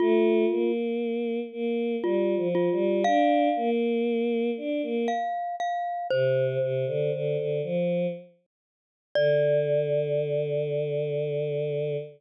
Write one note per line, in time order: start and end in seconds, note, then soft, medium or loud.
0.00 0.45 A3 loud
0.00 0.72 F4 medium
0.50 1.40 A#3 medium
1.52 1.96 A#3 loud
2.03 2.35 G3 medium
2.03 2.48 F4 medium
2.37 2.69 F3 loud
2.55 3.03 F4 medium
2.72 3.04 G3 loud
3.04 3.49 D4 loud
3.04 3.70 F5 medium
3.56 4.50 A#3 loud
4.57 4.82 D4 medium
4.82 5.07 A#3 loud
5.08 5.56 F5 medium
5.60 6.07 F5 medium
6.10 6.58 C3 loud
6.10 7.58 C5 medium
6.61 6.85 C3 loud
6.86 7.11 D3 loud
7.13 7.37 D3 loud
7.37 7.61 D3 medium
7.63 8.07 F3 loud
9.15 11.96 D3 loud
9.15 11.96 D5 loud